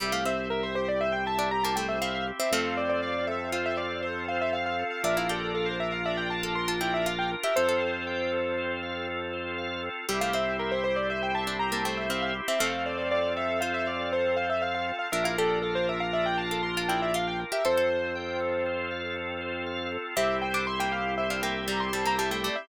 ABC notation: X:1
M:5/4
L:1/16
Q:1/4=119
K:Cmix
V:1 name="Acoustic Grand Piano"
e f e2 B c c d e g a2 b a g e f f z e | f2 d d d2 e2 f e d2 c2 f e f f2 f | e f A2 A c e f e g a2 c' a g e f g z e | c12 z8 |
e f e2 B c c d e g a2 b a g e f f z e | f2 d d d2 e2 f e d2 c2 f e f f2 f | e f A2 A c e f e g a2 c' a g e f g z e | c12 z8 |
e2 g d' c' g f2 e f g2 b c' a b a g d e |]
V:2 name="Pizzicato Strings"
G, A, C2 z7 D z B, A,2 C2 z C | [A,C]8 F6 z6 | D E G2 z7 A z F E2 F2 z G | A A5 z14 |
G, A, C2 z7 D z B, A,2 C2 z C | [A,C]8 F6 z6 | D E G2 z7 A z F E2 F2 z G | A A5 z14 |
C3 D z B,2 z2 D B,2 G,2 G, B, G, A, A, z |]
V:3 name="Drawbar Organ"
G2 c2 e2 G2 c2 e2 G2 c2 e2 G2 | A2 c2 f2 A2 c2 f2 A2 c2 f2 A2 | B2 d2 f2 B2 d2 f2 B2 d2 f2 B2 | A2 c2 g2 A2 c2 f2 A2 c2 f2 A2 |
G2 c2 e2 G2 c2 e2 G2 c2 e2 G2 | A2 c2 f2 A2 c2 f2 A2 c2 f2 A2 | B2 d2 f2 B2 d2 f2 B2 d2 f2 B2 | A2 c2 g2 A2 c2 f2 A2 c2 f2 A2 |
G2 c2 e2 G2 c2 e2 G2 c2 e2 G2 |]
V:4 name="Drawbar Organ" clef=bass
C,,20 | F,,20 | B,,,20 | F,,20 |
C,,20 | F,,20 | B,,,20 | F,,20 |
C,,20 |]
V:5 name="Drawbar Organ"
[CEG]20 | [CFA]20 | [DFB]20 | [CFA]20 |
[CEG]20 | [CFA]20 | [DFB]20 | [CFA]20 |
[CEG]20 |]